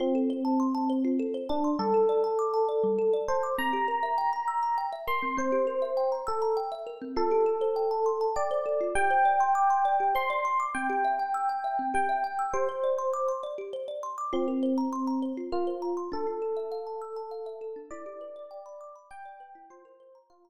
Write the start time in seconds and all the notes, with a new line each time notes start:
0.00 C4 F4
0.15 A4
0.30 C5
0.45 A5
0.60 C6
0.75 A5
0.90 C5
1.05 F4
1.19 A4
1.34 C5
1.49 D4 A5
1.64 C6
1.79 G3 A4
1.94 A4
2.09 D5
2.24 A5
2.39 D6
2.54 A5
2.69 D5
2.84 G3
2.99 A4
3.13 D5
3.28 C5 A5
3.43 D6
3.58 C4 A#5
3.73 G4
3.88 A#4
4.03 E5
4.18 G5
4.33 A#5
4.48 E6
4.63 A#5
4.78 G5
4.93 E5
5.07 A#4 C6
5.23 C4
5.37 C4 C5
5.52 G4
5.67 A#4
5.82 E5
5.97 G5
6.12 A#5
6.27 A4 E6
6.42 A#5
6.57 G5
6.72 E5
6.87 A#4
7.02 C4
7.16 F4 A4
7.31 G4
7.46 A4
7.61 C5
7.76 G5
7.91 A5
8.06 C6
8.21 A5
8.36 D5 G5
8.51 C5
8.66 A4
8.81 F4
8.95 G4 G5
9.10 C5
9.25 D5
9.40 C6
9.55 D6
9.70 C6
9.85 D5
10.00 G4
10.15 C5 C6
10.30 D5
10.45 C6
10.60 D6
10.75 C4 G5
10.90 G4
11.04 E5
11.19 G5
11.34 E6
11.49 G5
11.64 E5
11.79 C4
11.94 G4 G5
12.09 E5
12.24 G5
12.39 E6
12.53 G4 C5
12.69 C5
12.84 D5
12.99 C6
13.13 D6
13.28 C6
13.43 D5
13.58 G4
13.73 C5
13.88 D5
14.03 C6
14.18 D6
14.33 C4 F4
14.48 A#4
14.63 C5
14.78 A#5
14.93 C6
15.07 A#5
15.22 C5
15.37 F4
15.52 F4 A#4
15.67 C5
15.82 A#5
15.97 C6
16.12 D4 A4
16.27 F4
16.42 A4
16.57 E5
16.72 F5
16.87 A5
17.01 E6
17.16 A5
17.31 F5
17.46 E5
17.61 A4
17.76 D4
17.91 E4 D5
18.06 G4
18.21 B4
18.36 D5
18.51 G5
18.66 B5
18.81 D6
18.96 B5
19.11 G5
19.25 D5
19.40 B4
19.55 E4
19.70 F4 C5
19.85 A#4
20.00 C5
20.15 A#5
20.30 F4 C6
20.45 A#5